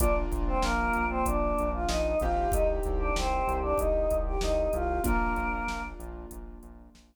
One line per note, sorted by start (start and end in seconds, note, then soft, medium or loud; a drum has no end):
0.00 0.26 A#1 medium
0.00 2.11 A#3 medium
0.00 0.15 D4 medium
0.00 2.11 D4 medium
0.00 2.11 F4 medium
0.00 0.15 D5 medium
0.00 kick loud
0.00 closed hi-hat loud
0.31 0.58 A#1 medium
0.31 kick medium
0.31 closed hi-hat medium
0.48 0.63 C4 medium
0.48 0.63 C5 medium
0.62 0.90 A#1 medium
0.62 1.05 A#3 medium
0.62 1.05 A#4 medium
0.62 snare loud
0.93 1.23 A#1 medium
0.93 closed hi-hat medium
1.09 1.24 C4 medium
1.09 1.24 C5 medium
1.26 1.53 A#1 medium
1.26 1.69 D4 medium
1.26 1.69 D5 medium
1.26 kick medium
1.26 closed hi-hat loud
1.58 1.86 A#1 medium
1.58 closed hi-hat medium
1.73 1.88 F4 medium
1.73 1.88 F5 medium
1.88 2.15 A#1 medium
1.88 2.18 D#4 medium
1.88 2.18 D#5 medium
1.88 snare loud
2.20 2.48 A#1 medium
2.20 5.02 C4 medium
2.20 5.02 D#4 medium
2.20 2.51 F4 medium
2.20 5.02 G4 medium
2.20 2.51 F5 medium
2.20 kick medium
2.20 closed hi-hat medium
2.52 2.80 C2 medium
2.52 2.68 D#4 medium
2.52 2.68 D#5 medium
2.52 kick loud
2.52 closed hi-hat loud
2.83 3.13 C2 medium
2.83 kick medium
2.83 closed hi-hat medium
2.99 3.14 D4 medium
2.99 3.14 D5 medium
3.16 3.43 C2 medium
3.16 3.56 C4 medium
3.16 3.56 C5 medium
3.16 snare loud
3.48 3.74 C2 medium
3.48 closed hi-hat medium
3.63 3.78 D4 medium
3.63 3.78 D5 medium
3.78 4.08 C2 medium
3.78 4.17 D#4 medium
3.78 4.17 D#5 medium
3.78 kick medium
3.78 closed hi-hat medium
4.11 4.38 C2 medium
4.11 kick medium
4.11 closed hi-hat medium
4.26 4.41 G4 medium
4.26 4.41 G5 medium
4.41 4.69 C2 medium
4.41 4.71 D#4 medium
4.41 4.71 D#5 medium
4.41 snare loud
4.73 5.00 C2 medium
4.73 5.01 F4 medium
4.73 5.01 F5 medium
4.73 closed hi-hat medium
5.04 5.33 A#1 medium
5.04 7.15 A#3 medium
5.04 5.82 A#3 medium
5.04 7.15 D4 medium
5.04 7.15 F4 medium
5.04 5.82 A#4 medium
5.04 kick loud
5.04 closed hi-hat loud
5.36 5.63 A#1 medium
5.36 kick medium
5.36 closed hi-hat medium
5.67 5.94 A#1 medium
5.67 snare loud
6.00 6.26 A#1 medium
6.00 closed hi-hat medium
6.31 6.59 A#1 medium
6.31 kick medium
6.31 closed hi-hat loud
6.63 6.90 A#1 medium
6.63 closed hi-hat medium
6.94 7.15 A#1 medium
6.94 snare loud